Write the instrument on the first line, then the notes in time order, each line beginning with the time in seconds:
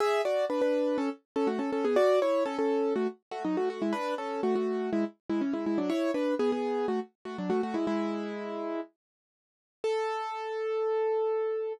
acoustic grand piano
0.00 G#4 E5
0.25 F#4 D5
0.50 D4 B4
0.61 D4 B4
0.98 C#4 A4
1.36 C#4 A4
1.47 A3 F#4
1.59 C#4 A4
1.72 C#4 A4
1.85 B3 G#4
1.96 F#4 D5
2.22 E4 C#5
2.45 C#4 A4
2.59 C#4 A4
2.96 A3 F#4
3.31 A3 F#4
3.44 F#3 D#4
3.57 A3 F#4
3.70 A3 F#4
3.82 G#3 E4
3.93 D4 B4
4.18 C#4 A4
4.43 A3 F#4
4.55 A3 F#4
4.93 G#3 E4
5.30 G#3 E4
5.41 E3 C#4
5.53 G#3 E4
5.66 G#3 E4
5.78 F#3 D4
5.90 E4 C#5
6.14 D4 B4
6.39 B3 G#4
6.52 B3 G#4
6.88 A3 F#4
7.25 A3 F#4
7.38 F#3 D4
7.50 A3 F#4
7.63 A3 F#4
7.74 G#3 E4
7.87 G#3 E4
9.84 A4